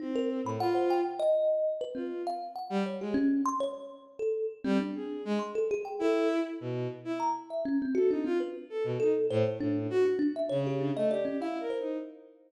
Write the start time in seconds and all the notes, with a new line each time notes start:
0.00 C4 D#4
0.15 A#4
0.44 A2 B5
0.60 F4 F#5
0.75 C5
0.90 G5
1.20 D#5
1.81 B4
1.95 C4 F4
2.27 F5
2.56 F#5
2.70 G3
2.86 C#5
3.01 G#3 G4
3.14 C#4
3.46 C6
3.60 C#5
4.19 A4
4.64 G3 C4
4.80 D4
4.95 G#4
5.25 G#3
5.39 C6
5.55 A4
5.71 G#4
5.85 G5
5.99 E4 A4
6.61 B2
7.05 E4
7.20 A#5
7.50 E5
7.65 C#4
7.82 C4
7.95 F#4 A4
8.10 D4 D#4
8.25 C4 F4
8.40 B4
8.70 A4
8.84 B2
9.00 D#4 A4
9.30 A2 C5
9.60 A2 D4
9.90 F#4
10.05 F#4
10.19 D4
10.36 E5
10.49 C#3 C#5
10.67 G4
10.81 D4
10.96 A3 D#5
11.10 G4 D5
11.25 C#4
11.40 E4 F5
11.60 A#4
11.70 C5
11.80 D#4